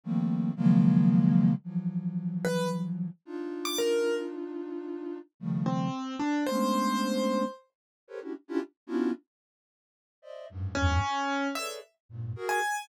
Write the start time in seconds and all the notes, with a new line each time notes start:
0.04 D#3 F3 G3 A3 A#3 C4
0.56 C#3 D#3 F3 F#3 G#3 A#3
1.64 E3 F3 F#3
2.45 B4
3.25 D4 D#4 F4
3.65 D6
3.78 A#4
5.40 C#3 D#3 F3 G3 A3
5.66 C4
6.19 D4
6.46 G#3 A3 B3 C#4 D4 C5
8.08 G4 A4 A#4 B4 C5 C#5
8.21 C#4 D4 E4 F#4 G4
8.48 C#4 D4 E4 F4 G4
8.87 B3 C#4 D4 E4 F4 F#4
10.22 C5 D5 D#5 E5
10.49 F#2 G2 G#2
10.75 E2 F#2 G2 G#2 C#4
11.55 G#4 A4 B4 C#5 D5 E5
12.09 G2 G#2 A#2
12.36 F#4 G#4 A#4
12.49 G#5